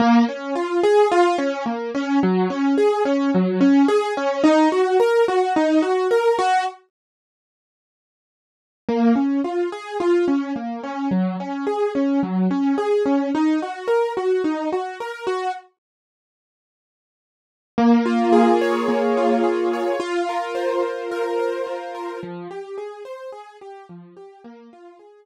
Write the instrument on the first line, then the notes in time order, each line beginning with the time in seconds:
acoustic grand piano
0.00 A#3
0.28 C#4
0.55 F4
0.83 G#4
1.12 F4
1.38 C#4
1.66 A#3
1.95 C#4
2.23 F#3
2.50 C#4
2.78 G#4
3.05 C#4
3.34 F#3
3.61 C#4
3.88 G#4
4.17 C#4
4.44 D#4
4.72 F#4
5.00 A#4
5.28 F#4
5.56 D#4
5.82 F#4
6.11 A#4
6.39 F#4
8.89 A#3
9.16 C#4
9.44 F4
9.72 G#4
10.00 F4
10.28 C#4
10.56 A#3
10.83 C#4
11.11 F#3
11.40 C#4
11.67 G#4
11.95 C#4
12.23 F#3
12.51 C#4
12.78 G#4
13.06 C#4
13.35 D#4
13.62 F#4
13.88 A#4
14.17 F#4
14.44 D#4
14.72 F#4
15.00 A#4
15.27 F#4
17.78 A#3
18.06 F4
18.33 G#4
18.61 C#5
18.88 A#3
19.17 F4
19.44 G#4
19.73 C#5
20.00 F4
20.29 A#4
20.55 C5
20.83 F4
21.11 A#4
21.39 C5
21.67 F4
21.95 A#4
22.23 F3
22.51 G4
22.78 G#4
23.05 C5
23.32 G#4
23.61 G4
23.89 F3
24.17 G4
24.44 A#3
24.73 F4
24.99 G#4